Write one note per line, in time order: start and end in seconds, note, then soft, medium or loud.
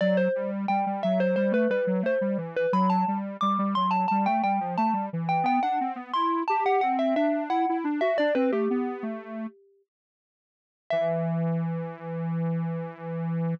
0.01 0.28 F#3 medium
0.01 0.17 D5 loud
0.17 0.50 C5 medium
0.35 0.66 G3 medium
0.68 0.85 G3 medium
0.68 1.01 G5 medium
0.86 1.03 G3 medium
1.03 1.36 F#3 medium
1.03 1.19 E5 medium
1.20 1.35 C5 medium
1.36 1.53 G3 medium
1.36 1.52 C5 medium
1.52 1.68 A3 medium
1.52 1.70 B4 medium
1.69 1.86 G3 medium
1.69 2.01 B4 medium
1.87 2.03 F#3 medium
2.03 2.19 A3 medium
2.03 2.38 C5 medium
2.21 2.37 G3 medium
2.38 2.66 E3 medium
2.57 2.73 B4 medium
2.73 3.05 F#3 medium
2.73 2.89 B5 medium
2.90 3.18 A5 medium
3.08 3.37 G3 medium
3.41 3.58 G3 medium
3.41 3.73 D6 medium
3.59 3.75 G3 medium
3.75 4.06 F#3 medium
3.75 3.91 C6 medium
3.91 4.07 A5 medium
4.08 4.27 G3 medium
4.08 4.24 A5 medium
4.26 4.42 A3 medium
4.26 4.42 G5 medium
4.43 4.60 G3 medium
4.43 4.74 G5 medium
4.60 4.77 F3 medium
4.78 4.94 A3 medium
4.78 5.06 A5 medium
4.93 5.10 G3 medium
5.13 5.44 E3 medium
5.29 5.45 G5 medium
5.43 5.60 B3 medium
5.43 5.62 G5 loud
5.63 5.79 D4 medium
5.63 5.93 F#5 medium
5.81 5.97 C4 medium
5.96 6.12 B3 medium
6.13 6.43 E4 medium
6.13 6.42 C6 loud
6.48 6.64 G4 medium
6.48 6.64 A5 medium
6.65 6.81 G4 medium
6.65 6.81 F#5 medium
6.81 7.15 C4 medium
6.81 6.97 F#5 medium
6.99 7.15 E5 medium
7.16 7.49 D4 medium
7.16 7.43 E5 medium
7.49 7.66 E4 medium
7.49 7.77 F#5 medium
7.69 7.85 E4 medium
7.84 8.00 D4 medium
8.01 8.17 F#4 medium
8.01 8.17 E5 medium
8.18 8.35 D4 medium
8.18 8.34 D5 loud
8.35 8.51 C4 medium
8.35 8.51 B4 medium
8.52 8.68 A3 medium
8.52 9.82 G4 medium
8.70 9.03 B3 medium
9.03 9.47 A3 medium
10.90 13.54 E3 loud
10.90 13.53 E5 loud